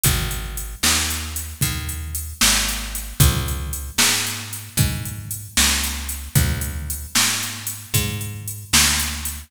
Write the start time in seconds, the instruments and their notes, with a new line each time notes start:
0.04 electric bass (finger) G#1, kick, closed hi-hat
0.31 closed hi-hat
0.57 closed hi-hat
0.83 electric bass (finger) D#2, snare
1.10 closed hi-hat
1.36 closed hi-hat
1.61 electric bass (finger) D#2, kick, closed hi-hat
1.89 closed hi-hat
2.15 closed hi-hat
2.41 electric bass (finger) G#1, snare
2.69 closed hi-hat
2.95 closed hi-hat
3.20 electric bass (finger) C#2, kick, closed hi-hat
3.48 closed hi-hat
3.73 closed hi-hat
3.98 electric bass (finger) G#2, snare
4.27 closed hi-hat
4.53 closed hi-hat
4.77 electric bass (finger) G#2, kick, closed hi-hat
5.05 closed hi-hat
5.31 closed hi-hat
5.57 electric bass (finger) C#2, snare
5.84 closed hi-hat
6.09 closed hi-hat
6.35 electric bass (finger) D2, kick, closed hi-hat
6.61 closed hi-hat
6.90 closed hi-hat
7.15 electric bass (finger) G#2, snare
7.43 closed hi-hat
7.67 closed hi-hat
7.94 electric bass (finger) G#2, kick, closed hi-hat
8.21 closed hi-hat
8.48 closed hi-hat
8.73 electric bass (finger) D2, snare
8.99 closed hi-hat
9.25 closed hi-hat